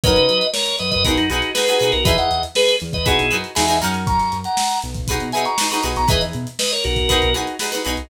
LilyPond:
<<
  \new Staff \with { instrumentName = "Drawbar Organ" } { \time 4/4 \key fis \mixolydian \tempo 4 = 119 <b' dis''>4 <ais' cis''>8 <b' dis''>16 <b' dis''>16 <fis' ais'>16 <dis' fis'>16 <dis' fis'>8 <gis' b'>8. <fis' ais'>16 | <b' dis''>16 <dis'' fis''>8 r16 <gis' b'>8 r16 <b' dis''>16 <e' gis'>8. r16 <e'' gis''>8 r8 | <ais'' cis'''>8. <fis'' ais''>8. r4 <e'' gis''>16 <ais'' cis'''>8 <ais'' cis'''>16 r16 <ais'' cis'''>16 | <b' dis''>16 r8. <b' dis''>16 <ais' cis''>16 <fis' ais'>4 r4. | }
  \new Staff \with { instrumentName = "Pizzicato Strings" } { \time 4/4 \key fis \mixolydian <dis' fis' ais' cis''>2 <dis' fis' gis' b'>8 <dis' fis' gis' b'>8 <dis' fis' gis' b'>16 <dis' fis' gis' b'>16 <dis' fis' gis' b'>8 | <dis' e' gis' b'>2 <dis' fis' gis' b'>8 <dis' fis' gis' b'>8 <dis' fis' gis' b'>16 <dis' fis' gis' b'>16 <cis' dis' fis' ais'>8~ | <cis' dis' fis' ais'>2 <dis' fis' gis' b'>8 <dis' fis' gis' b'>8 <dis' fis' gis' b'>16 <dis' fis' gis' b'>16 <dis' fis' gis' b'>8 | <dis' e' gis' b'>2 <dis' fis' gis' b'>8 <dis' fis' gis' b'>8 <dis' fis' gis' b'>16 <dis' fis' gis' b'>16 <dis' fis' gis' b'>8 | }
  \new Staff \with { instrumentName = "Synth Bass 1" } { \clef bass \time 4/4 \key fis \mixolydian fis,16 cis16 fis4 fis,16 fis,16 b,,16 fis,16 b,,4 b,16 b,,16 | e,16 e,16 e,4 e,16 e,16 b,,16 b,,16 fis,8 e,8 fis,8~ | fis,16 fis,16 fis,4 b,,8. b,16 b,4 b,,16 b,,16 | e,16 e,16 b,4 b,,8. b,,16 b,,4 b,,16 b,,16 | }
  \new DrumStaff \with { instrumentName = "Drums" } \drummode { \time 4/4 <hh bd>16 hh16 hh16 hh16 sn16 hh16 <hh sn>16 <hh bd>16 <hh bd>16 hh16 hh16 hh16 sn16 hh16 hh16 hh16 | <hh bd>16 hh16 hh16 hh16 sn16 hh16 hh16 <hh bd>16 <hh bd>16 hh16 hh16 hh16 sn16 hh16 hh16 hh16 | <hh bd>16 <hh sn>16 hh16 hh16 sn16 <hh sn>16 hh16 <hh bd>16 <hh bd>16 hh16 hh16 hh16 sn16 <hh sn>16 hh16 <hh sn>16 | <hh bd>16 <hh sn>16 hh16 hh16 sn16 hh16 hh16 <hh bd>16 <hh bd>16 hh16 hh16 hh16 sn16 hh16 <hh sn>16 hh16 | }
>>